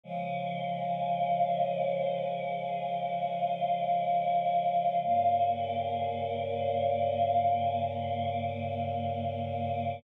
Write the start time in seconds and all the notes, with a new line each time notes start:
0.04 C#3 F3 G#3
5.04 G2 C#3 A#3